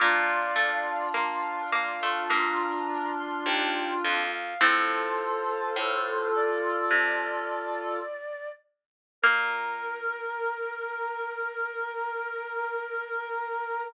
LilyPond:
<<
  \new Staff \with { instrumentName = "Flute" } { \time 4/4 \key bes \major \tempo 4 = 52 <d'' f''>4 f''8 f''8 bes''8. c'''16 g''8 f''16 f''16 | <a' c''>4. d''2 r8 | bes'1 | }
  \new Staff \with { instrumentName = "Clarinet" } { \time 4/4 \key bes \major <d' f'>1 | <f' a'>2.~ <f' a'>8 r8 | bes'1 | }
  \new Staff \with { instrumentName = "Harpsichord" } { \time 4/4 \key bes \major bes8 a8 bes8 bes16 a16 bes2 | <a c'>2. r4 | bes1 | }
  \new Staff \with { instrumentName = "Pizzicato Strings" } { \clef bass \time 4/4 \key bes \major bes,2 g,4 ees,8 f,8 | a,4 a,4 c2 | bes,1 | }
>>